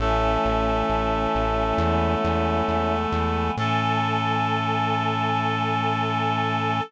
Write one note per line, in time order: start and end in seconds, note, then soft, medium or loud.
0.00 0.38 A1 loud
0.00 1.78 E3 medium
0.00 3.51 A3 medium
0.00 1.78 A3 medium
0.00 2.96 C#4 medium
0.00 1.78 C#4 medium
0.00 2.96 E4 loud
0.00 3.51 A4 medium
0.45 0.83 A1 medium
0.89 1.27 A1 medium
1.35 1.73 A1 medium
1.78 2.16 E2 loud
1.78 3.56 E3 medium
1.78 3.56 G#3 medium
1.78 3.56 B3 medium
2.24 2.62 E2 loud
2.68 3.07 E2 medium
3.12 3.50 E2 loud
3.57 6.81 A2 loud
3.57 6.80 E3 medium
3.57 6.80 A3 medium
3.57 6.80 C#4 loud
3.57 6.82 A4 loud